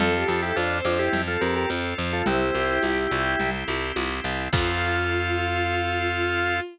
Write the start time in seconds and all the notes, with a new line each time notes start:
0.00 F2 C4 F4 A4, low conga
0.14 G4
0.28 F2 F4 A4, high conga
0.42 E4 G4 A4
0.56 F2 C4 D4 F4 C5, tambourine, high conga
0.85 F2 D4 F4, high conga
0.99 E4 G4
1.13 F2 C4, low conga
1.28 F4 A4
1.41 F2 G4 A4 A#4, high conga
1.56 G4 A#4
1.70 F2 F4, tambourine, high conga
1.98 F2 C4
2.13 F4 A4
2.26 C2 C4 E4 G4 C5, low conga
2.54 C2 G4, high conga
2.82 C2 C4, tambourine, high conga
3.11 C2 E4, high conga
3.40 C2 C4, low conga
3.67 C2 G4, high conga
3.96 C2 E4, tambourine, high conga
4.24 C2 C4
4.53 F2 C4 F4 A4, kick, crash